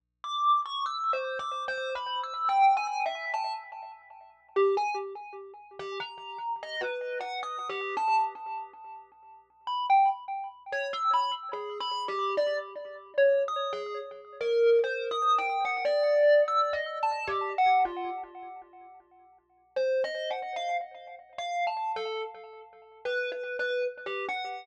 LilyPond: \new Staff { \time 6/4 \tempo 4 = 73 r16 d'''8 cis'''16 \tuplet 3/2 { e'''8 c''8 d'''8 c''8 b''8 e'''8 g''8 gis''8 e''8 } a''16 r4 r16 g'16 gis''16 | r4 g'16 ais''8. dis''16 b'8 fis''16 \tuplet 3/2 { dis'''8 g'8 a''8 } r4. r16 b''16 | g''16 r8. cis''16 e'''16 b''16 r16 \tuplet 3/2 { gis'8 b''8 g'8 } d''16 r8. \tuplet 3/2 { cis''8 dis'''8 gis'8 } r8 ais'8 | \tuplet 3/2 { c''8 dis'''8 g''8 } fis''16 d''8. \tuplet 3/2 { e'''8 dis''8 a''8 g'8 fis''8 f'8 } r2 |
\tuplet 3/2 { c''8 dis''8 fis''8 } f''16 r8. \tuplet 3/2 { f''8 a''8 a'8 } r4 \tuplet 3/2 { b'8 b'8 b'8 } r16 g'16 fis''8 | }